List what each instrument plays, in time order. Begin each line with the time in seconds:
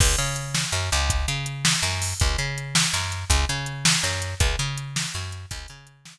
0.00 electric bass (finger) C#2, kick, crash
0.18 electric bass (finger) C#3, closed hi-hat
0.36 closed hi-hat
0.55 snare
0.72 electric bass (finger) F#2, closed hi-hat
0.92 electric bass (finger) C#2, closed hi-hat
1.10 kick, closed hi-hat
1.28 electric bass (finger) C#3, closed hi-hat
1.46 closed hi-hat
1.65 snare
1.83 electric bass (finger) F#2, closed hi-hat
2.02 open hi-hat
2.20 electric bass (finger) C#2, kick, closed hi-hat
2.38 electric bass (finger) C#3, closed hi-hat
2.58 closed hi-hat
2.75 snare
2.93 electric bass (finger) F#2, closed hi-hat
3.12 closed hi-hat
3.30 electric bass (finger) C#2, kick, closed hi-hat
3.49 electric bass (finger) C#3, closed hi-hat
3.66 closed hi-hat
3.85 snare
4.03 electric bass (finger) F#2, closed hi-hat
4.22 closed hi-hat
4.40 electric bass (finger) C#2, kick, closed hi-hat
4.59 electric bass (finger) C#3, closed hi-hat
4.78 closed hi-hat
4.96 snare
5.14 electric bass (finger) F#2, closed hi-hat
5.32 closed hi-hat
5.51 electric bass (finger) C#2, kick, closed hi-hat
5.68 electric bass (finger) C#3, closed hi-hat
5.87 closed hi-hat
6.05 snare